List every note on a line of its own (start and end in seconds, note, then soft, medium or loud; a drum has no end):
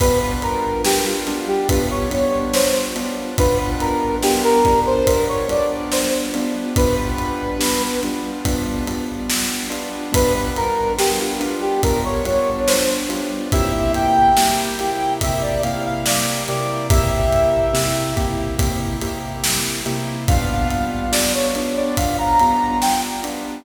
0.00 0.76 G3 medium
0.00 0.76 B3 medium
0.00 0.76 D4 medium
0.00 0.76 F4 medium
0.00 0.40 B4 medium
0.00 kick medium
0.00 ride loud
0.42 0.82 A#4 medium
0.42 ride medium
0.85 1.24 G3 medium
0.85 1.24 B3 medium
0.85 1.24 D4 medium
0.85 1.24 F4 medium
0.85 1.05 G4 medium
0.85 snare loud
1.05 1.40 F4 medium
1.27 1.67 G3 medium
1.27 1.67 B3 medium
1.27 1.67 D4 medium
1.27 1.67 F4 medium
1.27 ride medium
1.48 1.68 G4 medium
1.69 2.09 G3 medium
1.69 2.09 B3 medium
1.69 2.09 D4 medium
1.69 2.09 F4 medium
1.69 1.89 B4 medium
1.69 kick medium
1.69 ride medium
1.90 2.11 C#5 medium
2.10 2.88 G3 medium
2.10 2.88 B3 medium
2.10 2.88 D4 medium
2.10 2.88 F4 medium
2.10 2.53 C#5 medium
2.10 ride medium
2.54 2.74 C5 medium
2.54 snare loud
2.96 3.35 G3 medium
2.96 3.35 B3 medium
2.96 3.35 D4 medium
2.96 3.35 F4 medium
2.96 ride medium
3.38 4.17 G3 medium
3.38 4.17 B3 medium
3.38 4.17 D4 medium
3.38 4.17 F4 medium
3.38 3.77 B4 medium
3.38 kick medium
3.38 ride medium
3.80 4.16 A#4 medium
3.80 ride medium
4.22 4.62 G3 medium
4.22 4.62 B3 medium
4.22 4.62 D4 medium
4.22 4.62 F4 medium
4.22 4.42 G4 medium
4.22 snare medium
4.44 4.80 A#4 medium
4.65 5.05 G3 medium
4.65 5.05 B3 medium
4.65 5.05 D4 medium
4.65 5.05 F4 medium
4.65 kick medium
4.65 ride medium
4.86 5.06 C5 medium
5.07 5.45 G3 medium
5.07 5.45 B3 medium
5.07 5.45 D4 medium
5.07 5.45 F4 medium
5.07 5.27 A#4 medium
5.07 kick medium
5.07 ride medium
5.28 5.48 C#5 medium
5.49 6.27 G3 medium
5.49 6.27 B3 medium
5.49 6.27 D4 medium
5.49 6.27 F4 medium
5.49 5.91 D5 medium
5.49 ride medium
5.92 6.12 C5 medium
5.92 snare medium
6.34 6.74 G3 medium
6.34 6.74 B3 medium
6.34 6.74 D4 medium
6.34 6.74 F4 medium
6.34 ride medium
6.76 7.54 G3 medium
6.76 7.54 B3 medium
6.76 7.54 D4 medium
6.76 7.54 F4 medium
6.76 7.82 B4 medium
6.76 kick medium
6.76 ride medium
7.18 ride medium
7.60 7.98 G3 medium
7.60 7.98 B3 medium
7.60 7.98 D4 medium
7.60 7.98 F4 medium
7.60 snare loud
8.03 8.42 G3 medium
8.03 8.42 B3 medium
8.03 8.42 D4 medium
8.03 8.42 F4 medium
8.03 ride medium
8.45 8.84 G3 medium
8.45 8.84 B3 medium
8.45 8.84 D4 medium
8.45 8.84 F4 medium
8.45 kick medium
8.45 ride medium
8.87 9.65 G3 medium
8.87 9.65 B3 medium
8.87 9.65 D4 medium
8.87 9.65 F4 medium
8.87 ride medium
9.30 snare loud
9.70 10.09 G3 medium
9.70 10.09 B3 medium
9.70 10.09 D4 medium
9.70 10.09 F4 medium
9.70 ride medium
10.12 10.90 G3 medium
10.12 10.90 B3 medium
10.12 10.90 D4 medium
10.12 10.90 F4 medium
10.12 10.50 B4 loud
10.12 kick medium
10.12 ride loud
10.56 10.93 A#4 loud
10.56 ride medium
10.98 11.37 G3 medium
10.98 11.37 B3 medium
10.98 11.37 D4 medium
10.98 11.37 F4 medium
10.98 11.18 G4 medium
10.98 snare medium
11.20 11.56 F4 medium
11.40 11.79 G3 medium
11.40 11.79 B3 medium
11.40 11.79 D4 medium
11.40 11.79 F4 medium
11.40 ride medium
11.61 11.82 G4 medium
11.83 12.22 G3 medium
11.83 12.22 B3 medium
11.83 12.22 D4 medium
11.83 12.22 F4 medium
11.83 12.03 A#4 medium
11.83 kick medium
11.83 ride medium
12.05 12.25 C#5 medium
12.25 13.03 G3 medium
12.25 13.03 B3 medium
12.25 13.03 D4 medium
12.25 13.03 F4 medium
12.25 12.59 C#5 medium
12.25 ride medium
12.67 12.87 C5 medium
12.67 snare loud
13.09 13.48 G3 medium
13.09 13.48 B3 medium
13.09 13.48 D4 medium
13.09 13.48 F4 medium
13.09 ride medium
13.52 14.31 C3 medium
13.52 14.31 A#3 medium
13.52 14.31 E4 medium
13.52 14.31 G4 medium
13.52 13.92 E5 loud
13.52 kick medium
13.52 ride medium
13.94 15.13 G5 loud
13.94 ride medium
14.37 14.76 C3 medium
14.37 14.76 A#3 medium
14.37 14.76 E4 medium
14.37 14.76 G4 medium
14.37 snare loud
14.79 15.19 C3 medium
14.79 15.19 A#3 medium
14.79 15.19 E4 medium
14.79 15.19 G4 medium
14.79 ride medium
15.21 15.61 C3 medium
15.21 15.61 A#3 medium
15.21 15.61 E4 medium
15.21 15.61 G4 medium
15.21 15.42 E5 medium
15.21 kick medium
15.21 ride loud
15.42 15.62 D5 medium
15.63 16.42 C3 medium
15.63 16.42 A#3 medium
15.63 16.42 E4 medium
15.63 16.42 G4 medium
15.63 15.83 F5 medium
15.63 ride medium
15.85 16.05 F5 medium
16.06 16.44 D5 medium
16.06 snare loud
16.48 16.87 C3 medium
16.48 16.87 A#3 medium
16.48 16.87 E4 medium
16.48 16.87 G4 medium
16.48 16.87 D5 medium
16.48 ride medium
16.90 17.68 C3 medium
16.90 17.68 A#3 medium
16.90 17.68 E4 medium
16.90 17.68 G4 medium
16.90 18.11 E5 medium
16.90 kick loud
16.90 ride loud
17.32 ride medium
17.73 18.12 C3 medium
17.73 18.12 A#3 medium
17.73 18.12 E4 medium
17.73 18.12 G4 medium
17.73 snare medium
18.16 18.55 C3 medium
18.16 18.55 A#3 medium
18.16 18.55 E4 medium
18.16 18.55 G4 medium
18.16 kick medium
18.16 ride medium
18.58 18.97 C3 medium
18.58 18.97 A#3 medium
18.58 18.97 E4 medium
18.58 18.97 G4 medium
18.58 kick medium
18.58 ride medium
19.01 19.80 C3 medium
19.01 19.80 A#3 medium
19.01 19.80 E4 medium
19.01 19.80 G4 medium
19.01 ride medium
19.44 snare loud
19.86 20.25 C3 medium
19.86 20.25 A#3 medium
19.86 20.25 E4 medium
19.86 20.25 G4 medium
19.86 ride medium
20.28 21.08 G3 medium
20.28 21.08 B3 medium
20.28 21.08 D4 medium
20.28 21.08 F4 medium
20.28 20.68 F5 loud
20.28 kick loud
20.28 ride medium
20.70 21.10 F5 medium
20.70 ride medium
21.12 21.51 G3 medium
21.12 21.51 B3 medium
21.12 21.51 D4 medium
21.12 21.51 F4 medium
21.12 21.32 D5 medium
21.12 snare loud
21.34 21.73 C#5 medium
21.55 21.95 G3 medium
21.55 21.95 B3 medium
21.55 21.95 D4 medium
21.55 21.95 F4 medium
21.55 ride medium
21.76 21.96 D5 medium
21.97 22.36 G3 medium
21.97 22.36 B3 medium
21.97 22.36 D4 medium
21.97 22.36 F4 medium
21.97 22.17 F5 medium
21.97 kick medium
21.97 ride medium
22.18 22.38 A#5 medium
22.39 23.18 G3 medium
22.39 23.18 B3 medium
22.39 23.18 D4 medium
22.39 23.18 F4 medium
22.39 22.78 A#5 medium
22.39 ride medium
22.82 23.02 G5 medium
22.82 snare medium
23.24 23.63 G3 medium
23.24 23.63 B3 medium
23.24 23.63 D4 medium
23.24 23.63 F4 medium
23.24 ride medium